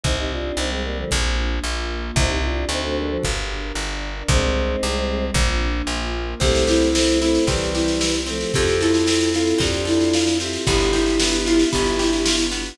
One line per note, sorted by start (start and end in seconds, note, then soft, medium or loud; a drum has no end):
0.04 0.52 C2 medium
0.04 0.16 C4 medium
0.04 0.57 C4 loud
0.04 0.16 D#4 medium
0.04 0.58 D#4 medium
0.04 0.57 G4 medium
0.04 kick medium
0.19 0.32 D#4 medium
0.19 0.32 G4 medium
0.32 0.58 D4 medium
0.32 0.58 F4 medium
0.57 1.05 C2 medium
0.57 1.10 G3 medium
0.57 0.70 C4 medium
0.57 1.10 C4 medium
0.57 0.70 D#4 medium
0.57 1.10 G4 medium
0.71 0.83 G#3 medium
0.71 0.83 C4 medium
0.85 0.97 G3 medium
0.85 0.97 A#3 medium
0.97 1.10 D3 medium
0.97 1.10 F3 medium
1.11 1.60 A#1 loud
1.11 1.63 A#3 medium
1.11 1.63 D4 medium
1.11 1.63 F4 medium
1.11 kick medium
1.63 2.11 A#1 medium
1.63 2.16 A#3 loud
1.63 2.16 F4 medium
1.63 2.16 A#4 medium
2.16 2.65 C2 loud
2.16 2.68 C4 medium
2.16 2.30 C4 medium
2.16 2.68 D#4 loud
2.16 2.28 D#4 medium
2.16 2.68 G4 medium
2.16 kick loud
2.29 2.41 D#4 medium
2.29 2.41 G4 medium
2.44 2.66 D4 medium
2.44 2.66 F4 medium
2.69 3.18 D2 medium
2.69 2.83 C4 medium
2.69 3.22 D4 medium
2.69 2.84 D#4 medium
2.69 3.22 F#4 medium
2.69 3.22 A4 loud
2.84 2.97 A3 medium
2.84 2.97 C4 medium
2.98 3.10 G3 medium
2.98 3.10 A#3 medium
3.10 3.23 F3 medium
3.23 3.72 G1 medium
3.23 3.76 D4 medium
3.23 3.76 G4 medium
3.23 3.76 A#4 medium
3.23 kick medium
3.75 4.23 G1 medium
3.75 4.30 D4 medium
3.75 4.30 A#4 medium
3.75 4.30 D5 medium
4.28 4.76 C2 loud
4.28 5.25 G#3 medium
4.28 4.82 C4 medium
4.28 5.25 C4 medium
4.28 4.82 D#4 medium
4.28 4.82 G4 medium
4.28 kick loud
4.83 5.31 C2 medium
4.83 5.36 G3 medium
4.83 5.36 C4 medium
4.83 5.36 G4 medium
5.34 5.82 A#1 loud
5.34 5.88 A#3 medium
5.34 5.89 D4 medium
5.34 5.88 F4 medium
5.34 kick medium
5.87 6.35 A#1 medium
5.87 6.41 A#3 medium
5.87 6.41 F4 loud
5.87 6.41 A#4 medium
6.40 7.39 C2 medium
6.40 6.89 A3 medium
6.40 6.95 C4 medium
6.40 8.51 C4 medium
6.40 6.89 C4 medium
6.40 8.51 E4 medium
6.40 8.51 G4 medium
6.40 6.63 G4 medium
6.40 kick medium
6.40 snare medium
6.55 snare medium
6.67 7.18 E4 medium
6.67 7.75 G4 medium
6.67 snare medium
6.82 snare medium
6.95 7.20 A3 medium
6.95 7.20 C4 medium
6.95 7.47 C4 medium
6.95 snare loud
7.08 snare medium
7.21 7.45 A3 medium
7.21 7.45 C4 medium
7.21 7.44 E4 medium
7.21 8.00 E4 medium
7.21 snare medium
7.35 snare medium
7.47 8.45 C2 medium
7.47 8.14 E3 medium
7.47 8.14 G3 medium
7.47 8.26 C4 medium
7.47 7.70 G4 medium
7.47 kick medium
7.47 snare medium
7.61 snare medium
7.74 8.20 E4 medium
7.74 8.51 G4 medium
7.74 snare medium
7.88 snare medium
8.01 8.51 E4 medium
8.01 snare medium
8.14 snare medium
8.26 8.52 F3 medium
8.26 8.52 A3 medium
8.26 8.52 C4 medium
8.26 snare medium
8.41 snare medium
8.54 9.54 F2 medium
8.54 9.06 C4 loud
8.54 10.66 C4 medium
8.54 9.04 F4 medium
8.54 10.66 F4 medium
8.54 8.76 G4 medium
8.54 9.04 A4 medium
8.54 10.66 A4 medium
8.54 kick medium
8.54 snare medium
8.67 snare medium
8.81 9.32 E4 medium
8.81 9.85 A4 medium
8.81 snare medium
8.94 snare medium
9.07 9.58 C4 medium
9.07 9.30 F4 medium
9.07 9.30 A4 medium
9.07 snare medium
9.21 snare medium
9.33 9.59 E4 medium
9.33 9.56 F4 medium
9.33 10.14 F4 medium
9.33 9.56 A4 medium
9.33 snare medium
9.47 snare medium
9.58 10.58 F2 medium
9.58 10.41 C4 medium
9.58 10.26 D4 medium
9.58 10.26 F4 medium
9.58 9.85 G4 medium
9.58 kick medium
9.58 snare medium
9.74 snare medium
9.85 10.38 E4 medium
9.85 10.61 A4 medium
9.85 snare medium
10.01 snare medium
10.13 10.65 F4 medium
10.13 snare medium
10.27 snare medium
10.40 10.66 C4 medium
10.40 10.65 E4 medium
10.40 10.65 G4 medium
10.40 snare medium
10.53 snare medium
10.66 11.65 G1 medium
10.66 12.77 B3 medium
10.66 11.20 B3 loud
10.66 12.77 D4 medium
10.66 12.37 E4 medium
10.66 12.77 F4 medium
10.66 12.37 G4 medium
10.66 12.77 G4 medium
10.66 10.90 G4 medium
10.66 kick medium
10.66 snare medium
10.80 snare medium
10.93 11.36 E4 medium
10.93 11.99 G4 medium
10.93 snare medium
11.06 snare medium
11.20 11.72 B3 medium
11.20 snare loud
11.33 snare medium
11.46 11.68 E4 medium
11.46 12.25 F4 medium
11.46 snare medium
11.59 snare medium
11.73 12.72 G1 medium
11.73 12.51 B3 medium
11.73 11.97 G4 medium
11.73 kick medium
11.73 snare medium
11.86 snare medium
11.99 12.45 E4 medium
11.99 12.75 G4 medium
11.99 snare medium
12.13 snare medium
12.26 12.76 F4 medium
12.26 snare loud
12.39 snare medium
12.52 12.77 B3 medium
12.52 snare medium
12.66 snare medium